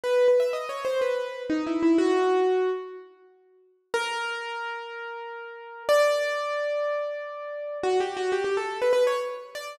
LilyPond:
\new Staff { \time 4/4 \key b \major \tempo 4 = 123 b'8 b'16 e''16 \tuplet 3/2 { dis''8 cis''8 c''8 } b'4 \tuplet 3/2 { dis'8 e'8 e'8 } | fis'4. r2 r8 | \key b \minor ais'1 | d''1 |
\tuplet 3/2 { fis'8 g'8 fis'8 } g'16 g'16 a'8 b'16 b'16 cis''16 r8. d''8 | }